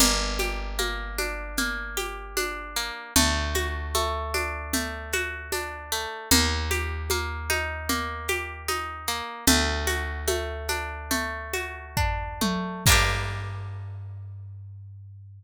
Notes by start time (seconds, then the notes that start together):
0.00 G1 A#3, low conga, shaker
0.39 G4, high conga, shaker
0.78 A#3, high conga, shaker
1.18 D4, high conga, shaker
1.57 A#3, low conga, shaker
1.97 G4, high conga, shaker
2.37 D4, high conga, shaker
2.76 A#3, shaker
3.16 D2 A3, low conga, shaker
3.54 F#4, high conga, shaker
3.94 A3, high conga, shaker
4.34 D4, high conga, shaker
4.73 A3, low conga, shaker
5.13 F#4, high conga, shaker
5.52 D4, high conga, shaker
5.92 A3, shaker
6.31 D#2 A#3, low conga, shaker
6.71 G4, high conga, shaker
7.10 A#3, high conga, shaker
7.50 D#4, high conga, shaker
7.89 A#3, low conga, shaker
8.28 G4, high conga, shaker
8.68 D#4, high conga, shaker
9.07 A#3, shaker
9.47 D2 A3, low conga, shaker
9.87 F#4, high conga, shaker
10.28 A3, high conga, shaker
10.68 D4, high conga, shaker
11.11 A3, low conga, shaker
11.53 F#4, high conga, shaker
11.97 D4, kick, floor tom
12.41 A3, high tom
12.86 G2 A#3 D4, kick, crash
12.92 G4